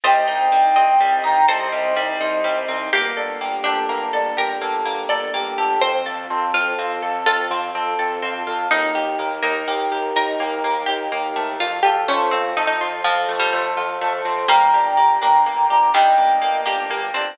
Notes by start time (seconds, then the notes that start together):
0.04 C2 G3 C4 D#4 C5 D#5 G5
0.28 C2 C4 D#4
0.51 C2 G3 D#4
0.76 C2 G3 C4 D#5
1.00 C2 G3 C4
1.24 C2 D#4 D#5 G5 A#5
1.48 C2 G3 C4 A4 C5 D#5
1.72 C2 G3 C4
1.96 C2 G3 D#4
2.20 C2 G3 D#4 C5 D#5
2.44 C2 G3 C4
2.68 C2 C4 D#4
2.93 G1 A#3 G4
3.17 G1 D4 A4
3.41 G1 A#3 G4
3.64 G1 D4 G4 A4
3.89 G1 A#3
4.13 G1 D4 A4
4.37 G1 G4 A#4
4.61 G1 A#3 A4
4.85 G1 A#3
5.09 G1 D4 A4 D5
5.34 G1 A#3 G4
5.58 G1 G4 A4
5.81 F2 C4 C5
6.06 F2 F4 A4
6.30 F2 C4 A4
6.54 F2 C4 F4
6.78 F2 C4 F4
7.02 F2 A4
7.26 F2 C4 F4 A4
7.50 F2 C4 F4
7.74 F2 C4 A4
7.99 F2 C4 A4
8.22 F2 C4 F4
8.47 F2 F4 A4
8.71 D#2 A#3 D#4
8.95 D#2 G4
9.19 D#2 A#3 A#4
9.42 D#2 A#3 D#4
9.67 D#2 A#3 G4
9.91 D#2 G4 A#4
10.15 D#2 D#4 A#4
10.40 D#2 A#3 G4
10.64 D#2 A#3 A#4
10.86 D#2 D#4 G4
11.12 D#2 A#3 G4
11.36 D#2 A3 A#4
11.60 F2 F4
11.83 F2 F4 G4 A4
12.08 F2 A3 C#4 C5
12.31 F2 C4 F4
12.56 F2 A3 D#4 A4
12.67 D#4
12.81 F2 F4 C5
13.04 F2 F3 C4 F4
13.29 F2 A3 A4
13.39 G3
13.53 F2 A3 C5
13.77 F2 F4
14.01 F2 A3 A4
14.25 F2 C4 C5
14.48 G1 G3 A#3 D4 G5 A#5
14.73 G1 D4 G4
14.97 G1 A#3 G4
15.21 G1 A#3 D4
15.45 G1 A#3
15.70 G1 D4 G4 A#5 D6
15.94 G1 D#3 G3 D4 G4 D#5 G5
16.18 G1 A#3 D4
16.42 G1 A#3
16.66 G1 A#3 D4 G4
16.90 G1 A#3 G4
17.14 G1 C4 D4